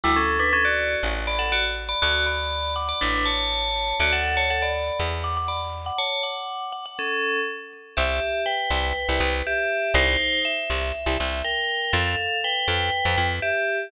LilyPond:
<<
  \new Staff \with { instrumentName = "Tubular Bells" } { \time 4/4 \key d \major \tempo 4 = 121 <g e'>16 <cis' a'>8 <d' b'>16 <cis' a'>16 <fis' d''>8. r8 <d'' b''>16 <a' fis''>16 <fis' d''>16 r8 <d'' b''>16 | <fis' d''>8 <d'' b''>4 <fis'' d'''>16 <d'' b''>16 <d' b'>8 <cis'' a''>4. | <fis' d''>16 <a' fis''>8 <cis'' a''>16 <a' fis''>16 <d'' b''>8. r8 <fis'' d'''>16 <fis'' d'''>16 <d'' b''>16 r8 <fis'' d'''>16 | <cis'' a''>8 <fis'' d'''>4 <fis'' d'''>16 <fis'' d'''>16 <cis' a'>4 r4 |
\key c \major <g' e''>4 <b' g''>2 <g' e''>4 | <ees' c''>4 e''2 <bes' g''>4 | <a' f''>4 <b' g''>2 <g' e''>4 | }
  \new Staff \with { instrumentName = "Electric Bass (finger)" } { \clef bass \time 4/4 \key d \major d,2 a,,2 | d,2 a,,2 | d,2 e,2 | r1 |
\key c \major c,4. c,8. c,16 c,4. | c,4. c,8. c,16 c,4. | f,4. f,8. f,16 f,4. | }
>>